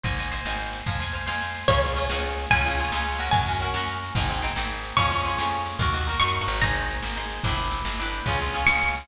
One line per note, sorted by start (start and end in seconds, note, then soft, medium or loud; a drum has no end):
0.03 0.41 G#1 medium
0.03 0.16 C5 medium
0.03 0.16 D#5 medium
0.03 0.16 G#5 medium
0.03 kick medium
0.03 snare medium
0.11 snare medium
0.18 0.31 C5 medium
0.18 0.31 D#5 medium
0.18 0.31 G#5 medium
0.18 snare medium
0.24 snare medium
0.32 0.44 C5 medium
0.32 0.44 D#5 medium
0.32 0.44 G#5 medium
0.32 snare medium
0.38 snare medium
0.45 0.82 G#1 medium
0.45 0.83 C5 medium
0.45 0.83 D#5 medium
0.45 0.83 G#5 medium
0.45 snare loud
0.52 snare medium
0.59 snare medium
0.65 snare medium
0.73 snare medium
0.79 snare medium
0.86 1.23 F2 medium
0.86 0.99 C5 medium
0.86 0.99 F5 medium
0.86 0.99 G#5 loud
0.86 kick medium
0.86 snare medium
0.93 snare medium
1.00 1.12 C5 medium
1.00 1.12 F5 medium
1.00 1.12 G#5 medium
1.00 snare medium
1.06 snare medium
1.13 1.26 C5 medium
1.13 1.26 F5 medium
1.13 1.26 G#5 medium
1.13 snare medium
1.21 snare medium
1.27 1.64 F2 medium
1.27 1.64 C5 medium
1.27 1.64 F5 medium
1.27 1.64 G#5 medium
1.27 snare loud
1.34 snare medium
1.41 snare medium
1.48 snare medium
1.55 snare medium
1.61 snare medium
1.68 2.05 C#2 medium
1.68 1.81 C#4 medium
1.68 1.81 F4 medium
1.68 1.81 G#4 medium
1.68 2.45 C#5 soft
1.68 kick loud
1.68 snare medium
1.75 snare medium
1.82 1.95 C#4 medium
1.82 1.95 F4 medium
1.82 1.95 G#4 medium
1.82 snare medium
1.89 snare medium
1.96 2.09 C#4 medium
1.96 2.09 F4 medium
1.96 2.09 G#4 medium
1.96 snare medium
2.03 snare medium
2.09 2.46 C#2 medium
2.09 2.47 C#4 medium
2.09 2.47 F4 medium
2.09 2.47 G#4 medium
2.09 snare loud
2.16 snare medium
2.23 snare medium
2.30 snare medium
2.37 snare medium
2.44 snare medium
2.50 2.88 C#2 medium
2.50 2.63 C#4 medium
2.50 2.63 F4 medium
2.50 2.63 G#4 medium
2.50 3.26 G#5 medium
2.50 kick medium
2.50 snare medium
2.57 snare medium
2.64 2.78 C#4 medium
2.64 2.78 F4 medium
2.64 2.78 G#4 medium
2.64 snare medium
2.71 snare medium
2.78 2.91 C#4 medium
2.78 2.91 F4 medium
2.78 2.91 G#4 medium
2.78 snare medium
2.85 snare medium
2.92 3.29 C#2 medium
2.92 3.18 C#4 medium
2.92 3.18 F4 medium
2.92 3.18 G#4 medium
2.92 snare loud
2.98 snare medium
3.06 snare medium
3.12 snare medium
3.18 3.45 C#4 medium
3.18 3.45 F#4 medium
3.18 3.45 A#4 medium
3.18 snare medium
3.26 snare medium
3.31 3.70 F#2 medium
3.31 4.13 G#5 medium
3.31 kick loud
3.31 snare medium
3.40 snare medium
3.47 3.59 C#4 medium
3.47 3.59 F#4 medium
3.47 3.59 A#4 medium
3.47 snare medium
3.53 snare medium
3.60 3.73 C#4 medium
3.60 3.73 F#4 medium
3.60 3.73 A#4 medium
3.60 snare medium
3.67 snare medium
3.74 4.11 F#2 medium
3.74 4.12 C#4 medium
3.74 4.12 F#4 medium
3.74 4.12 A#4 medium
3.74 snare loud
3.81 snare medium
3.87 snare medium
3.95 snare medium
4.02 snare medium
4.08 snare medium
4.15 4.52 G#1 medium
4.15 4.28 C4 medium
4.15 4.28 D#4 medium
4.15 4.28 G#4 medium
4.15 kick loud
4.15 snare medium
4.22 snare medium
4.29 4.41 C4 medium
4.29 4.41 D#4 medium
4.29 4.41 G#4 medium
4.29 snare medium
4.35 snare medium
4.42 4.55 C4 medium
4.42 4.55 D#4 medium
4.42 4.55 G#4 medium
4.42 snare medium
4.49 snare medium
4.56 4.93 G#1 medium
4.56 4.94 C4 medium
4.56 4.94 D#4 medium
4.56 4.94 G#4 medium
4.56 snare loud
4.63 snare medium
4.70 snare medium
4.77 snare medium
4.83 snare medium
4.90 snare medium
4.97 5.34 F2 medium
4.97 5.10 C#4 loud
4.97 5.10 F4 medium
4.97 5.10 G#4 medium
4.97 5.77 C#6 medium
4.97 kick medium
4.97 snare medium
5.04 snare medium
5.11 5.24 C#4 medium
5.11 5.24 F4 medium
5.11 5.24 G#4 medium
5.11 snare medium
5.18 snare medium
5.24 5.37 C#4 medium
5.24 5.37 F4 medium
5.24 5.37 G#4 medium
5.24 snare medium
5.31 snare medium
5.38 5.75 F2 medium
5.38 5.76 C#4 medium
5.38 5.76 F4 medium
5.38 5.76 G#4 medium
5.38 snare loud
5.45 snare medium
5.52 snare medium
5.59 snare medium
5.66 snare medium
5.72 snare medium
5.79 6.16 D#2 medium
5.79 5.92 D#4 medium
5.79 5.92 F#4 loud
5.79 5.92 A#4 medium
5.79 kick loud
5.79 snare medium
5.86 snare medium
5.93 6.06 D#4 medium
5.93 6.06 F#4 medium
5.93 6.06 A#4 medium
5.93 snare medium
6.00 snare medium
6.07 6.20 D#4 medium
6.07 6.20 F#4 medium
6.07 6.20 A#4 medium
6.07 snare medium
6.14 snare medium
6.20 6.39 F#2 medium
6.20 6.58 D#4 medium
6.20 6.58 F#4 medium
6.20 6.58 A#4 medium
6.20 6.60 C#6 medium
6.20 snare medium
6.28 snare medium
6.34 snare medium
6.41 6.47 G2 medium
6.41 snare medium
6.48 6.98 G#1 loud
6.48 snare medium
6.55 snare medium
6.61 7.12 D#4 medium
6.61 7.12 G#4 loud
6.61 7.12 C5 medium
6.61 7.39 A#5 soft
6.61 kick medium
6.61 snare medium
6.68 snare medium
6.75 snare medium
6.82 snare medium
6.89 snare medium
6.96 snare medium
7.02 7.40 G#1 medium
7.02 snare loud
7.10 snare medium
7.16 7.41 D#4 medium
7.16 7.41 G#4 medium
7.16 7.41 C5 medium
7.16 snare medium
7.23 snare medium
7.30 snare medium
7.37 snare medium
7.43 7.81 G1 medium
7.43 7.95 D4 loud
7.43 7.95 E4 loud
7.43 7.95 G4 medium
7.43 7.95 B4 medium
7.43 kick loud
7.43 snare medium
7.51 snare medium
7.57 snare medium
7.64 snare medium
7.71 snare medium
7.78 snare medium
7.85 8.22 G1 medium
7.85 snare loud
7.92 snare medium
7.99 8.24 D4 medium
7.99 8.24 E4 medium
7.99 8.24 G4 medium
7.99 8.24 B4 medium
7.99 snare medium
8.05 snare medium
8.12 snare medium
8.19 snare medium
8.26 8.63 C#2 medium
8.26 8.39 C#4 loud
8.26 8.39 F4 medium
8.26 8.39 G#4 medium
8.26 kick medium
8.26 snare medium
8.33 snare medium
8.40 8.52 C#4 medium
8.40 8.52 F4 medium
8.40 8.52 G#4 medium
8.40 snare medium
8.46 snare medium
8.53 8.66 C#4 medium
8.53 8.66 F4 medium
8.53 8.66 G#4 medium
8.53 snare medium
8.60 snare medium
8.66 9.04 C#2 medium
8.66 9.05 C#4 medium
8.66 9.05 F4 medium
8.66 9.05 G#4 medium
8.66 9.07 C#6 medium
8.66 snare loud
8.74 snare medium
8.81 snare medium
8.88 snare medium
8.95 snare medium
9.01 snare medium